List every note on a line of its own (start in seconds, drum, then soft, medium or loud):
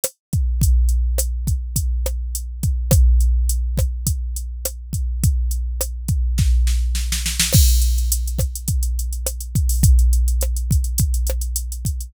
0.04 cross-stick medium
0.04 closed hi-hat loud
0.33 kick medium
0.33 closed hi-hat medium
0.61 kick medium
0.61 closed hi-hat medium
0.89 closed hi-hat medium
1.18 cross-stick medium
1.18 closed hi-hat loud
1.47 kick medium
1.47 closed hi-hat medium
1.76 kick medium
1.76 closed hi-hat loud
2.06 cross-stick medium
2.06 closed hi-hat medium
2.35 closed hi-hat medium
2.63 kick medium
2.63 closed hi-hat medium
2.91 kick loud
2.91 cross-stick loud
2.91 closed hi-hat loud
3.20 closed hi-hat medium
3.49 closed hi-hat medium
3.78 kick medium
3.78 cross-stick medium
3.78 closed hi-hat medium
4.07 kick medium
4.07 closed hi-hat loud
4.36 closed hi-hat medium
4.65 cross-stick medium
4.65 closed hi-hat loud
4.93 kick medium
4.93 closed hi-hat medium
5.24 kick medium
5.24 closed hi-hat medium
5.51 closed hi-hat medium
5.81 cross-stick medium
5.81 closed hi-hat loud
6.08 kick medium
6.08 closed hi-hat medium
6.38 kick medium
6.38 snare medium
6.67 snare medium
6.95 snare medium
7.12 snare medium
7.26 snare medium
7.40 snare loud
7.53 kick loud
7.53 cross-stick medium
7.53 crash loud
7.69 closed hi-hat medium
7.82 closed hi-hat medium
7.98 closed hi-hat medium
8.12 closed hi-hat loud
8.27 closed hi-hat medium
8.39 kick medium
8.39 cross-stick medium
8.39 closed hi-hat medium
8.55 closed hi-hat medium
8.68 kick medium
8.68 closed hi-hat medium
8.83 closed hi-hat medium
8.99 closed hi-hat medium
9.13 closed hi-hat medium
9.26 cross-stick medium
9.26 closed hi-hat loud
9.41 closed hi-hat medium
9.55 kick medium
9.55 closed hi-hat medium
9.69 open hi-hat medium
9.83 kick loud
9.83 closed hi-hat loud
9.99 closed hi-hat medium
10.13 closed hi-hat medium
10.28 closed hi-hat medium
10.41 cross-stick medium
10.41 closed hi-hat medium
10.56 closed hi-hat medium
10.71 kick medium
10.71 closed hi-hat medium
10.84 closed hi-hat medium
10.98 kick medium
10.98 closed hi-hat loud
11.14 closed hi-hat medium
11.27 cross-stick medium
11.27 closed hi-hat medium
11.41 closed hi-hat medium
11.56 closed hi-hat loud
11.72 closed hi-hat medium
11.85 kick medium
11.85 closed hi-hat medium
12.00 closed hi-hat medium